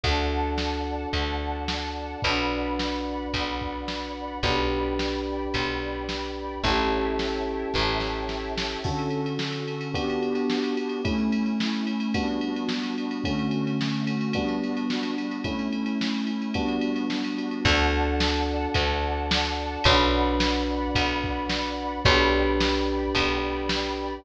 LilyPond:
<<
  \new Staff \with { instrumentName = "Electric Piano 1" } { \time 4/4 \key d \major \tempo 4 = 109 <d' fis' a'>1 | <d' fis' b'>1 | <d' g' b'>1 | <cis' e' g' a'>1 |
<d cis' fis' a'>2 <b d' fis' g'>2 | <a cis' e'>2 <g b d' fis'>2 | <d a cis' fis'>2 <g b d' fis'>2 | <a cis' e'>2 <g b d' fis'>2 |
<d' fis' a'>1 | <d' fis' b'>1 | <d' g' b'>1 | }
  \new Staff \with { instrumentName = "Electric Bass (finger)" } { \clef bass \time 4/4 \key d \major d,2 d,2 | b,,2 b,,2 | b,,2 b,,2 | a,,2 a,,2 |
r1 | r1 | r1 | r1 |
d,2 d,2 | b,,2 b,,2 | b,,2 b,,2 | }
  \new Staff \with { instrumentName = "Pad 5 (bowed)" } { \time 4/4 \key d \major <d'' fis'' a''>1 | <d'' fis'' b''>1 | <d'' g'' b''>1 | <cis'' e'' g'' a''>1 |
<d cis' fis' a'>2 <b d' fis' g'>2 | <a cis' e'>2 <g b d' fis'>2 | <d a cis' fis'>2 <g b d' fis'>2 | <a cis' e'>2 <g b d' fis'>2 |
<d'' fis'' a''>1 | <d'' fis'' b''>1 | <d'' g'' b''>1 | }
  \new DrumStaff \with { instrumentName = "Drums" } \drummode { \time 4/4 <cymc bd>4 sn4 <bd cymr>4 sn4 | <bd cymr>4 sn4 <bd cymr>8 bd8 sn4 | <bd cymr>4 sn4 <bd cymr>4 sn4 | <bd cymr>4 sn4 <bd sn>8 sn8 sn8 sn8 |
<cymc bd>16 cymr16 cymr16 cymr16 sn16 cymr16 cymr16 cymr16 <bd cymr>16 cymr16 cymr16 cymr16 sn16 cymr16 cymr16 cymr16 | <bd cymr>16 cymr16 cymr16 cymr16 sn16 cymr16 cymr16 cymr16 <bd cymr>16 cymr16 cymr16 cymr16 sn16 cymr16 cymr16 cymr16 | <bd cymr>16 cymr16 cymr16 cymr16 sn16 cymr16 cymr16 cymr16 <bd cymr>16 cymr16 cymr16 cymr16 sn16 cymr16 cymr16 cymr16 | <bd cymr>16 cymr16 cymr16 cymr16 sn16 cymr16 cymr16 cymr16 <bd cymr>16 cymr16 cymr16 cymr16 sn16 cymr16 cymr16 cymr16 |
<cymc bd>4 sn4 <bd cymr>4 sn4 | <bd cymr>4 sn4 <bd cymr>8 bd8 sn4 | <bd cymr>4 sn4 <bd cymr>4 sn4 | }
>>